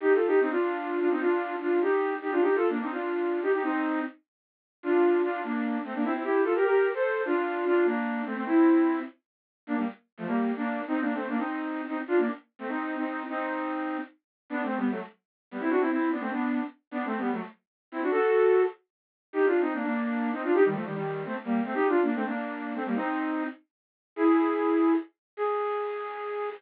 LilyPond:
\new Staff { \time 3/4 \key g \minor \tempo 4 = 149 \tuplet 3/2 { <ees' g'>8 <f' a'>8 <ees' g'>8 } <c' ees'>16 <d' f'>4~ <d' f'>16 <d' f'>16 <c' ees'>16 | <d' f'>4 <d' f'>8 <ees' g'>4 <ees' g'>16 <d' f'>16 | \tuplet 3/2 { <ees' g'>8 <f' a'>8 <bes d'>8 } <c' ees'>16 <d' f'>4~ <d' f'>16 <ees' g'>16 <ees' g'>16 | <c' ees'>4 r2 |
\key d \minor <d' f'>4 <d' f'>8 <bes d'>4 <a c'>16 <bes d'>16 | <c' e'>16 <c' e'>16 <e' g'>8 <f' a'>16 <g' bes'>16 <g' bes'>8. <a' c''>8. | <d' f'>4 <d' f'>8 <bes d'>4 <a c'>16 <a c'>16 | <c' e'>4. r4. |
\key g \minor <bes d'>16 <g bes>16 r8. <f a>16 <g bes>8. <bes d'>8. | \tuplet 3/2 { <c' ees'>8 <bes d'>8 <a c'>8 } <bes d'>16 <c' ees'>4~ <c' ees'>16 <c' ees'>16 r16 | <d' f'>16 <bes d'>16 r8. <a c'>16 <c' ees'>8. <c' ees'>8. | <c' ees'>2 r4 |
\key g \major \tuplet 3/2 { <b d'>8 <a c'>8 <g b>8 } <fis a>16 r4 r16 <g b>16 <c' e'>16 | <d' fis'>16 <c' e'>16 <c' e'>8 <b d'>16 <a c'>16 <b d'>8. r8. | \tuplet 3/2 { <b d'>8 <a c'>8 <g b>8 } <fis a>16 r4 r16 <c' e'>16 <d' fis'>16 | <fis' a'>4. r4. |
\key g \minor \tuplet 3/2 { <ees' g'>8 <d' f'>8 <c' ees'>8 } <bes d'>16 <bes d'>4~ <bes d'>16 <c' ees'>16 <d' f'>16 | <ees' g'>16 <ees g>16 <f a>16 <ees g>16 <ees g>8. <a c'>16 r16 <g bes>8 <a c'>16 | \tuplet 3/2 { <ees' g'>8 <d' f'>8 <bes d'>8 } <a c'>16 <bes d'>4~ <bes d'>16 <a c'>16 <g bes>16 | <c' ees'>4. r4. |
\key gis \minor <e' gis'>2 r4 | gis'2. | }